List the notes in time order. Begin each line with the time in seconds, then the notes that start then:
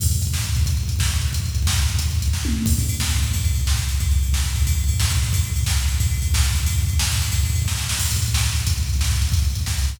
0.00 kick, crash
0.06 kick
0.11 kick, closed hi-hat
0.16 kick
0.22 kick, closed hi-hat
0.27 kick
0.33 kick, snare
0.39 kick
0.44 kick, closed hi-hat
0.49 kick
0.55 kick, closed hi-hat
0.61 kick
0.66 kick, closed hi-hat
0.71 kick
0.77 kick, closed hi-hat
0.83 kick
0.88 kick, closed hi-hat
0.96 kick
0.99 kick, snare
1.06 kick
1.11 kick, closed hi-hat
1.16 kick
1.21 kick, closed hi-hat
1.28 kick
1.33 kick, closed hi-hat
1.40 kick
1.44 kick, closed hi-hat
1.49 kick
1.55 kick, closed hi-hat
1.62 kick
1.67 kick, snare
1.73 kick
1.78 kick, closed hi-hat
1.83 kick
1.88 kick, closed hi-hat
1.95 kick, closed hi-hat
1.99 kick
2.06 kick
2.11 kick, closed hi-hat
2.15 kick
2.22 kick, closed hi-hat
2.28 kick
2.33 kick, snare
2.45 high tom
2.66 kick, crash
2.72 kick
2.78 kick, ride
2.83 kick
2.89 kick, ride
2.95 kick
3.00 kick, snare
3.05 kick
3.10 kick, ride
3.17 kick
3.22 kick, ride
3.28 kick
3.33 kick, ride
3.40 kick
3.44 kick, ride
3.51 kick, ride
3.56 kick
3.61 kick
3.67 kick, snare
3.73 kick
3.77 kick, ride
3.83 kick
3.88 kick, ride
3.95 kick
4.00 kick, ride
4.06 kick
4.11 kick, ride
4.16 kick
4.23 kick, ride
4.28 kick
4.33 kick, snare
4.39 kick
4.44 kick, ride
4.50 kick
4.56 kick, ride
4.62 kick
4.67 kick, ride
4.72 kick
4.78 kick, ride
4.84 kick
4.88 kick, ride
4.94 kick
5.00 kick, snare
5.04 kick
5.10 kick, ride
5.17 kick
5.22 kick, ride
5.29 kick
5.33 kick, ride
5.39 kick
5.44 kick, ride
5.50 kick
5.56 kick, ride
5.61 kick
5.66 kick, snare
5.72 kick
5.77 kick, ride
5.82 kick
5.88 kick, ride
5.95 kick
6.00 kick, ride
6.07 kick
6.11 kick, ride
6.18 kick
6.22 kick, ride
6.28 kick
6.34 kick, snare
6.39 kick
6.43 kick, ride
6.50 kick
6.55 kick, ride
6.60 kick
6.66 kick, ride
6.73 kick
6.78 kick, ride
6.83 kick
6.88 kick, ride
6.93 kick
6.99 kick, snare
7.05 kick
7.11 kick, ride
7.16 kick
7.22 kick, ride
7.28 kick, ride
7.33 kick
7.40 kick
7.44 kick, ride
7.50 kick
7.55 kick, ride
7.62 kick
7.66 kick, snare
7.77 snare
7.89 snare
7.99 kick, crash
8.05 kick, closed hi-hat
8.11 kick, closed hi-hat
8.16 kick, closed hi-hat
8.22 kick, closed hi-hat
8.28 kick, closed hi-hat
8.34 kick, snare
8.39 kick, closed hi-hat
8.43 kick, closed hi-hat
8.50 kick, closed hi-hat
8.55 kick, closed hi-hat
8.60 kick, closed hi-hat
8.67 kick, closed hi-hat
8.72 kick, closed hi-hat
8.77 kick, closed hi-hat
8.83 kick, closed hi-hat
8.89 kick, closed hi-hat
8.94 kick, closed hi-hat
8.99 kick, snare
9.04 kick, closed hi-hat
9.11 kick, closed hi-hat
9.16 kick, closed hi-hat
9.22 kick, closed hi-hat
9.27 kick, closed hi-hat
9.32 kick, closed hi-hat
9.39 kick, closed hi-hat
9.44 kick, closed hi-hat
9.50 kick, closed hi-hat
9.55 kick, closed hi-hat
9.61 kick, closed hi-hat
9.66 kick, snare
9.72 kick, closed hi-hat
9.77 kick, closed hi-hat
9.82 kick, closed hi-hat
9.88 kick, closed hi-hat
9.95 kick, closed hi-hat